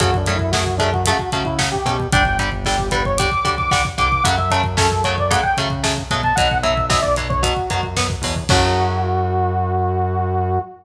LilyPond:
<<
  \new Staff \with { instrumentName = "Lead 2 (sawtooth)" } { \time 4/4 \key fis \phrygian \tempo 4 = 113 \tuplet 3/2 { fis'8 d'8 e'8 } fis'8 d'16 fis'16 fis'8 fis'16 e'16 r16 g'8. | g''8 r8 g'8 b'16 cis''16 d'''8. d'''16 d'''16 r16 d'''8 | fis''16 e''16 r8 a'8 cis''16 d''16 fis''16 g''16 r4 r16 a''16 | fis''8 e''8 e''16 d''16 r16 cis''16 fis'4 r4 |
fis'1 | }
  \new Staff \with { instrumentName = "Overdriven Guitar" } { \time 4/4 \key fis \phrygian <cis fis a>8 <cis fis a>8 <cis fis a>8 <cis fis a>8 <cis fis a>8 <cis fis a>8 <cis fis a>8 <cis fis a>8 | <d g>8 <d g>8 <d g>8 <d g>8 <d g>8 <d g>8 <d g>8 <d g>8 | <cis fis a>8 <cis fis a>8 <cis fis a>8 <cis fis a>8 <cis fis a>8 <cis fis a>8 <cis fis a>8 <cis fis a>8 | <b, fis>8 <b, fis>8 <b, fis>8 <b, fis>8 <b, fis>8 <b, fis>8 <b, fis>8 <b, fis>8 |
<cis fis a>1 | }
  \new Staff \with { instrumentName = "Synth Bass 1" } { \clef bass \time 4/4 \key fis \phrygian fis,2~ fis,8 cis4 b,8 | g,,2~ g,,8 d,4 c,8 | fis,2~ fis,8 cis4 b,8 | b,,2~ b,,8 fis,4 e,8 |
fis,1 | }
  \new DrumStaff \with { instrumentName = "Drums" } \drummode { \time 4/4 <hh bd>16 bd16 <hh bd>16 bd16 <bd sn>16 bd16 <hh bd>16 bd16 <hh bd>16 bd16 <hh bd>16 bd16 <bd sn>16 bd16 <hh bd>16 bd16 | <hh bd>16 bd16 <hh bd>16 bd16 <bd sn>16 bd16 <hh bd>16 bd16 <hh bd>16 bd16 <hh bd>16 bd16 <bd sn>16 bd16 <hh bd>16 bd16 | <hh bd>16 bd16 <hh bd>16 bd16 <bd sn>16 bd16 <hh bd>16 bd16 <hh bd>16 bd16 <hh bd>16 bd16 <bd sn>16 bd16 <hh bd>16 bd16 | <hh bd>16 bd16 <hh bd>16 bd16 <bd sn>16 bd16 <hh bd>16 bd16 <hh bd>16 bd16 <hh bd>16 bd16 <bd sn>16 bd16 <hho bd>16 bd16 |
<cymc bd>4 r4 r4 r4 | }
>>